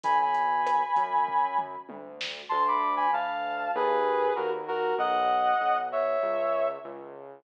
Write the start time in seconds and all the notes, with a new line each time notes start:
0.03 B1 G#5 B5, kick, closed hi-hat
0.22 G#5 B5
0.34 closed hi-hat
0.66 cross-stick, closed hi-hat
0.96 F#2, kick, closed hi-hat
1.28 kick
1.59 mid tom
1.89 D2, high tom
2.21 snare
2.49 D2 A5 C6
2.68 B5 D6
2.96 G#5 B5
3.13 D2 F5 A5
3.75 D#2 G#4 B4
4.36 D#2 F#4 A#4
4.68 F#4 A#4
4.98 B1 D#5 F#5
5.61 B1
5.92 C#5 E5
6.23 C#2
6.84 C#2